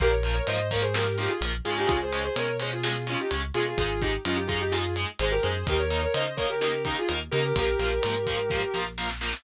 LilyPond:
<<
  \new Staff \with { instrumentName = "Distortion Guitar" } { \time 4/4 \key bes \dorian \tempo 4 = 127 <g' bes'>16 <bes' des''>8 <bes' des''>16 <c'' ees''>8 <bes' des''>16 <aes' c''>16 <g' bes'>8 <ees' g'>16 <f' aes'>16 r8 <f' aes'>16 <ees' g'>16 | <f' aes'>16 <aes' c''>8 <aes' c''>16 <bes' des''>8 <aes' c''>16 <f' aes'>16 <f' aes'>8 <des' f'>16 <ees' g'>16 r8 <f' aes'>16 <f' aes'>16 | <f' aes'>8 <ees' g'>16 r16 <des' f'>16 <ees' g'>16 <f' aes'>16 <ees' g'>16 <f' aes'>8 r8 <aes' c''>16 <g' bes'>16 <aes' c''>8 | <g' bes'>16 <bes' des''>8 <bes' des''>16 <c'' ees''>8 <bes' des''>16 <g' bes'>16 <g' bes'>8 <ees' g'>16 <f' aes'>16 r8 <g' bes'>16 <g' bes'>16 |
<g' bes'>2. r4 | }
  \new Staff \with { instrumentName = "Overdriven Guitar" } { \time 4/4 \key bes \dorian <f bes>8 <f bes>8 <f bes>8 <f bes>8 <f bes>8 <f bes>8 <f bes>8 <aes des'>8~ | <aes des'>8 <aes des'>8 <aes des'>8 <aes des'>8 <aes des'>8 <aes des'>8 <aes des'>8 <aes des'>8 | <aes ees'>8 <aes ees'>8 <aes ees'>8 <aes ees'>8 <aes ees'>8 <aes ees'>8 <aes ees'>8 <aes ees'>8 | <bes ees'>8 <bes ees'>8 <bes ees'>8 <bes ees'>8 <bes ees'>8 <bes ees'>8 <bes ees'>8 <bes ees'>8 |
<f bes>8 <f bes>8 <f bes>8 <f bes>8 <f bes>8 <f bes>8 <f bes>8 <f bes>8 | }
  \new Staff \with { instrumentName = "Synth Bass 1" } { \clef bass \time 4/4 \key bes \dorian bes,,4 aes,2 bes,,8 aes,8 | des,4 b,2 des,8 b,8 | aes,,4 ges,2 aes,,8 ges,8 | ees,4 des2 ees,8 des8 |
bes,,8 bes,,8 aes,4. bes,,4. | }
  \new DrumStaff \with { instrumentName = "Drums" } \drummode { \time 4/4 <hh bd>8 hh8 hh8 <hh bd>8 sn8 hh8 hh8 hh8 | <hh bd>8 hh8 hh8 hh8 sn8 hh8 hh8 hh8 | <hh bd>8 <hh bd>8 hh8 <hh bd>8 sn8 hh8 hh8 hh8 | <hh bd>8 hh8 hh8 <hh bd>8 sn8 <hh bd>8 hh8 hh8 |
<hh bd>8 hh8 hh8 <hh bd>8 <bd sn>8 sn8 sn16 sn16 sn16 sn16 | }
>>